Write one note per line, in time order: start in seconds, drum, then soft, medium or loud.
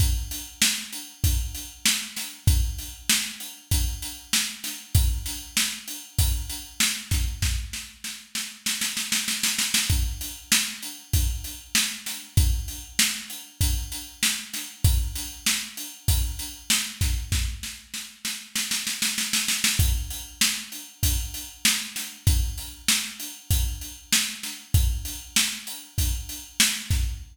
0.00 kick medium
0.00 closed hi-hat medium
0.31 closed hi-hat medium
0.62 snare loud
0.93 closed hi-hat medium
1.24 kick medium
1.24 closed hi-hat medium
1.55 closed hi-hat medium
1.86 snare loud
2.16 snare medium
2.16 closed hi-hat medium
2.47 kick loud
2.47 closed hi-hat loud
2.78 closed hi-hat medium
3.09 snare loud
3.40 closed hi-hat medium
3.71 kick medium
3.71 closed hi-hat loud
4.02 closed hi-hat medium
4.33 snare loud
4.64 snare medium
4.64 closed hi-hat medium
4.95 kick loud
4.95 closed hi-hat loud
5.26 snare soft
5.26 closed hi-hat medium
5.57 snare loud
5.88 closed hi-hat medium
6.19 kick medium
6.19 closed hi-hat loud
6.49 closed hi-hat medium
6.80 snare loud
7.11 kick medium
7.11 snare medium
7.11 closed hi-hat medium
7.42 kick medium
7.42 snare medium
7.73 snare medium
8.04 snare medium
8.35 snare medium
8.66 snare medium
8.81 snare medium
8.97 snare medium
9.12 snare medium
9.28 snare medium
9.43 snare medium
9.59 snare medium
9.74 snare loud
9.90 kick medium
9.90 closed hi-hat medium
10.21 closed hi-hat medium
10.52 snare loud
10.83 closed hi-hat medium
11.13 kick medium
11.13 closed hi-hat medium
11.44 closed hi-hat medium
11.75 snare loud
12.06 snare medium
12.06 closed hi-hat medium
12.37 kick loud
12.37 closed hi-hat loud
12.68 closed hi-hat medium
12.99 snare loud
13.30 closed hi-hat medium
13.61 kick medium
13.61 closed hi-hat loud
13.92 closed hi-hat medium
14.23 snare loud
14.53 snare medium
14.53 closed hi-hat medium
14.84 kick loud
14.84 closed hi-hat loud
15.15 snare soft
15.15 closed hi-hat medium
15.46 snare loud
15.77 closed hi-hat medium
16.08 kick medium
16.08 closed hi-hat loud
16.39 closed hi-hat medium
16.70 snare loud
17.01 kick medium
17.01 snare medium
17.01 closed hi-hat medium
17.32 kick medium
17.32 snare medium
17.63 snare medium
17.94 snare medium
18.25 snare medium
18.56 snare medium
18.71 snare medium
18.87 snare medium
19.02 snare medium
19.18 snare medium
19.33 snare medium
19.48 snare medium
19.64 snare loud
19.79 kick loud
19.79 closed hi-hat loud
20.10 closed hi-hat medium
20.41 snare loud
20.72 closed hi-hat medium
21.03 kick medium
21.03 closed hi-hat loud
21.34 closed hi-hat medium
21.65 snare loud
21.96 snare medium
21.96 closed hi-hat medium
22.27 kick loud
22.27 closed hi-hat loud
22.58 closed hi-hat medium
22.88 snare loud
23.20 closed hi-hat medium
23.51 kick medium
23.51 closed hi-hat medium
23.81 closed hi-hat medium
24.13 snare loud
24.43 snare medium
24.43 closed hi-hat medium
24.74 kick loud
24.74 closed hi-hat medium
25.05 closed hi-hat medium
25.36 snare loud
25.67 closed hi-hat medium
25.98 kick medium
25.98 closed hi-hat medium
26.29 closed hi-hat medium
26.60 snare loud
26.90 kick medium
26.90 snare medium
26.90 closed hi-hat medium